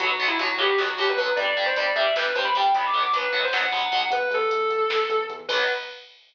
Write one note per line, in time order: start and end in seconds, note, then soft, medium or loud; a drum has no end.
0.00 0.17 B1 loud
0.00 0.08 F#3 loud
0.00 0.08 B3 loud
0.00 0.22 F#4 medium
0.00 kick loud
0.00 closed hi-hat loud
0.10 kick medium
0.19 0.35 B1 medium
0.19 0.27 F#3 loud
0.19 0.27 B3 loud
0.19 kick medium
0.19 closed hi-hat medium
0.28 0.37 E4 medium
0.28 kick medium
0.39 0.57 B1 medium
0.39 0.47 F#3 medium
0.39 0.47 B3 loud
0.39 0.57 F#4 medium
0.39 kick medium
0.39 closed hi-hat medium
0.49 kick medium
0.57 0.74 B1 loud
0.57 0.66 F#3 loud
0.57 0.66 B3 medium
0.57 0.79 G4 medium
0.57 kick medium
0.57 closed hi-hat medium
0.69 kick medium
0.78 0.95 B1 loud
0.78 0.86 F#3 loud
0.78 0.86 B3 medium
0.78 0.95 F#4 medium
0.78 kick medium
0.78 snare medium
0.88 kick medium
0.98 1.14 B1 loud
0.98 1.06 F#3 loud
0.98 1.06 B3 medium
0.98 1.08 G4 medium
0.98 kick medium
0.98 closed hi-hat medium
1.08 1.17 B4 medium
1.08 kick medium
1.17 1.33 B1 loud
1.17 1.26 F#3 loud
1.17 1.26 B3 medium
1.17 1.34 B4 medium
1.17 kick medium
1.17 closed hi-hat medium
1.27 kick medium
1.36 1.54 G1 loud
1.36 1.45 G3 loud
1.36 1.45 D4 loud
1.36 1.60 D5 medium
1.36 kick loud
1.36 closed hi-hat medium
1.47 kick medium
1.57 1.74 G1 loud
1.57 1.65 G3 loud
1.57 1.65 D4 medium
1.57 kick medium
1.57 closed hi-hat medium
1.66 1.75 C5 medium
1.66 kick medium
1.76 1.93 G1 loud
1.76 1.85 G3 loud
1.76 1.85 D4 medium
1.76 1.94 D5 medium
1.76 kick medium
1.76 closed hi-hat medium
1.86 kick medium
1.95 2.12 G1 medium
1.95 2.04 G3 loud
1.95 2.04 D4 medium
1.95 2.13 E5 medium
1.95 kick medium
1.95 closed hi-hat medium
2.06 kick medium
2.16 2.33 G1 medium
2.16 2.25 G3 loud
2.16 2.25 D4 loud
2.16 2.35 B4 medium
2.16 kick medium
2.16 snare loud
2.25 kick medium
2.35 2.52 G1 loud
2.35 2.43 G3 medium
2.35 2.43 D4 loud
2.35 2.44 C5 medium
2.35 kick medium
2.35 closed hi-hat medium
2.45 2.54 B5 medium
2.45 kick medium
2.55 2.72 G1 loud
2.55 2.63 G3 loud
2.55 2.63 D4 loud
2.55 2.75 G5 medium
2.55 kick medium
2.55 closed hi-hat medium
2.65 kick medium
2.74 2.91 B1 loud
2.74 2.83 F#3 loud
2.74 2.83 B3 loud
2.74 2.84 B5 loud
2.74 kick loud
2.74 closed hi-hat loud
2.84 3.02 D6 medium
2.84 kick medium
2.93 3.10 B1 loud
2.93 3.01 F#3 medium
2.93 3.01 B3 loud
2.93 kick medium
2.93 closed hi-hat medium
3.03 3.12 D6 medium
3.03 kick medium
3.12 3.29 B1 loud
3.12 3.21 F#3 loud
3.12 3.21 B3 medium
3.12 3.42 B4 medium
3.12 kick medium
3.12 closed hi-hat loud
3.24 kick medium
3.32 3.49 B1 loud
3.32 3.40 F#3 loud
3.32 3.40 B3 loud
3.32 kick medium
3.32 closed hi-hat medium
3.43 3.52 C5 medium
3.43 kick medium
3.53 3.70 B1 medium
3.53 3.61 F#3 medium
3.53 3.61 B3 medium
3.53 4.06 F#5 medium
3.53 kick medium
3.53 snare loud
3.63 kick medium
3.72 3.89 B1 loud
3.72 3.80 F#3 loud
3.72 3.80 B3 loud
3.72 kick medium
3.72 closed hi-hat medium
3.82 kick medium
3.92 4.09 B1 loud
3.92 4.00 F#3 loud
3.92 4.00 B3 medium
3.92 kick medium
3.92 closed hi-hat medium
4.02 kick medium
4.10 4.27 E2 loud
4.10 4.30 B4 medium
4.10 kick loud
4.10 closed hi-hat loud
4.21 kick medium
4.30 4.47 E2 loud
4.30 5.15 A4 medium
4.30 kick medium
4.30 closed hi-hat medium
4.41 kick medium
4.51 4.69 E2 medium
4.51 kick medium
4.51 closed hi-hat loud
4.61 kick medium
4.70 4.86 E2 medium
4.70 kick medium
4.70 closed hi-hat medium
4.80 kick medium
4.89 5.06 E2 medium
4.89 kick medium
4.89 snare loud
5.00 kick medium
5.09 5.26 E2 loud
5.09 kick medium
5.09 closed hi-hat medium
5.20 kick medium
5.29 5.46 E2 medium
5.29 kick medium
5.29 closed hi-hat medium
5.39 kick medium
5.49 5.62 B1 loud
5.49 5.63 F#3 loud
5.49 5.63 B3 loud
5.49 5.62 B4 loud
5.49 kick loud
5.49 crash loud